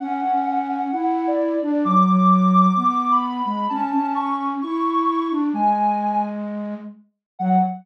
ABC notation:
X:1
M:4/4
L:1/16
Q:1/4=130
K:F#m
V:1 name="Ocarina"
f4 f2 f2 f3 d3 d2 | d'4 d'2 d'2 d'3 b3 b2 | a4 c'2 z2 c'6 z2 | g6 z10 |
f4 z12 |]
V:2 name="Flute"
C2 C6 E6 D2 | F,2 F,6 B,6 G,2 | C2 C6 E6 D2 | G,12 z4 |
F,4 z12 |]